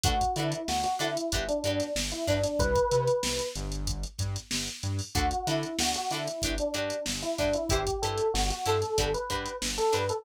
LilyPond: <<
  \new Staff \with { instrumentName = "Electric Piano 1" } { \time 4/4 \key d \mixolydian \tempo 4 = 94 fis'8 e'8 fis'16 fis'16 e'8. d'16 d'8 r16 e'16 d'16 d'16 | b'4. r2 r8 | fis'8 e'8 fis'16 fis'16 e'8. d'16 d'8 r16 e'16 d'16 e'16 | g'8 a'8 fis'16 fis'16 a'8. b'16 b'8 r16 a'16 b'16 a'16 | }
  \new Staff \with { instrumentName = "Acoustic Guitar (steel)" } { \time 4/4 \key d \mixolydian <d' fis' a' b'>8 <d' fis' a' b'>4 <d' fis' a' b'>8 <d' fis' g' b'>8 <d' fis' g' b'>4 <d' fis' g' b'>8 | r1 | <d' fis' a' b'>8 <d' fis' a' b'>4 <d' fis' a' b'>8 <d' fis' g' b'>8 <d' fis' g' b'>4 <d' fis' g' b'>8 | <e' g' b' c''>8 <e' g' b' c''>4 <e' g' b' c''>8 <d' fis' g' b'>8 <d' fis' g' b'>4 <d' fis' g' b'>8 | }
  \new Staff \with { instrumentName = "Synth Bass 1" } { \clef bass \time 4/4 \key d \mixolydian d,8 d8 d,8 d8 g,,8 g,8 g,,8 g,8 | c,8 c8 c,8 g,,4 g,8 g,,8 g,8 | d,8 d8 d,8 d8 g,,8 g,8 g,,8 g,8 | g,,8 g,8 g,,8 g,8 g,,8 g,8 g,,8 g,8 | }
  \new DrumStaff \with { instrumentName = "Drums" } \drummode { \time 4/4 <hh bd>16 <hh bd>16 hh16 hh16 sn16 hh16 <hh sn>16 hh16 <hh bd>16 hh16 hh16 <hh sn>16 sn16 hh16 <hh bd>16 <hh sn>16 | <hh bd>16 <hh bd>16 hh16 hh16 sn16 hh16 hh16 hh16 <hh bd>16 hh16 <hh bd sn>16 <hh sn>16 sn16 hh16 hh16 hho16 | <hh bd>16 hh16 <hh sn>16 hh16 sn16 hh16 <hh sn>16 <hh sn>16 <hh bd>16 hh16 hh16 hh16 sn16 hh16 <hh bd>16 hh16 | <hh bd>16 <hh bd>16 hh16 hh16 sn16 hh16 hh16 <hh sn>16 <hh bd>16 hh16 <hh bd>16 hh16 sn16 hh16 hh16 hh16 | }
>>